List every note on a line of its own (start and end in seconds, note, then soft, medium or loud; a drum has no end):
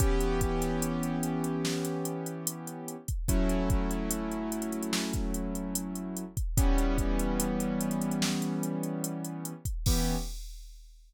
0.00 2.96 E3 loud
0.00 2.96 B3 loud
0.00 2.96 C#4 loud
0.00 2.96 G4 loud
0.00 kick loud
0.00 closed hi-hat loud
0.21 closed hi-hat medium
0.41 kick medium
0.41 closed hi-hat medium
0.61 snare soft
0.61 closed hi-hat medium
0.82 closed hi-hat loud
1.03 closed hi-hat medium
1.23 closed hi-hat medium
1.44 closed hi-hat medium
1.65 snare loud
1.85 closed hi-hat medium
2.05 closed hi-hat medium
2.26 closed hi-hat medium
2.47 closed hi-hat loud
2.67 closed hi-hat medium
2.88 closed hi-hat medium
3.08 kick medium
3.08 closed hi-hat medium
3.28 6.24 F#3 loud
3.28 6.24 A3 loud
3.28 6.24 C#4 loud
3.28 6.24 E4 loud
3.28 kick loud
3.28 closed hi-hat loud
3.49 closed hi-hat medium
3.70 kick loud
3.70 closed hi-hat medium
3.91 closed hi-hat medium
4.11 closed hi-hat loud
4.32 closed hi-hat medium
4.52 closed hi-hat medium
4.62 closed hi-hat medium
4.72 closed hi-hat medium
4.83 closed hi-hat medium
4.93 snare loud
5.13 kick medium
5.13 closed hi-hat medium
5.34 closed hi-hat medium
5.55 closed hi-hat medium
5.75 closed hi-hat loud
5.95 closed hi-hat medium
6.17 closed hi-hat medium
6.37 kick medium
6.37 closed hi-hat medium
6.57 9.53 E3 loud
6.57 9.53 G3 loud
6.57 9.53 B3 loud
6.57 9.53 C#4 loud
6.57 kick loud
6.57 closed hi-hat loud
6.78 closed hi-hat medium
6.98 kick medium
6.98 closed hi-hat medium
7.19 closed hi-hat medium
7.40 closed hi-hat loud
7.60 closed hi-hat medium
7.80 closed hi-hat medium
7.91 closed hi-hat medium
8.02 closed hi-hat medium
8.11 closed hi-hat medium
8.22 snare loud
8.42 closed hi-hat medium
8.63 closed hi-hat medium
8.83 closed hi-hat medium
9.04 closed hi-hat loud
9.24 closed hi-hat medium
9.45 closed hi-hat medium
9.65 kick medium
9.65 closed hi-hat medium
9.86 10.16 E3 loud
9.86 10.16 B3 loud
9.86 10.16 C#4 medium
9.86 10.16 G4 loud
9.86 kick loud
9.86 crash loud